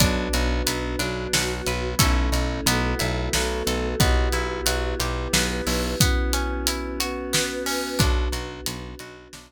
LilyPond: <<
  \new Staff \with { instrumentName = "Pizzicato Strings" } { \time 3/4 \key b \minor \tempo 4 = 90 d'8 fis'8 b'8 d'8 fis'8 b'8 | <cis' e' a'>4 b8 e'8 fis'8 a'8 | b8 e'8 fis'8 g'8 b8 e'8 | b8 cis'8 e'8 fis'8 b8 cis'8 |
d'8 fis'8 b'8 fis'8 d'8 r8 | }
  \new Staff \with { instrumentName = "Electric Bass (finger)" } { \clef bass \time 3/4 \key b \minor b,,8 b,,8 b,,8 b,,8 b,,8 b,,8 | b,,8 b,,8 b,,8 b,,8 b,,8 b,,8 | b,,8 b,,8 b,,8 b,,8 b,,8 b,,8 | r2. |
b,,8 b,,8 b,,8 b,,8 b,,8 r8 | }
  \new Staff \with { instrumentName = "Choir Aahs" } { \time 3/4 \key b \minor <b d' fis'>4. <fis b fis'>4. | <a cis' e'>4 <a b e' fis'>4 <a b fis' a'>4 | <b e' fis' g'>4. <b e' g' b'>4. | <b cis' e' fis'>4. <b cis' fis' b'>4. |
<b d' fis'>2. | }
  \new DrumStaff \with { instrumentName = "Drums" } \drummode { \time 3/4 <hh bd>8 hh8 hh8 hh8 sn8 hh8 | <hh bd>8 hh8 hh8 hh8 sn8 hh8 | <hh bd>8 hh8 hh8 hh8 sn8 hho8 | <hh bd>8 hh8 hh8 hh8 sn8 hho8 |
<hh bd>8 hh8 hh8 hh8 sn4 | }
>>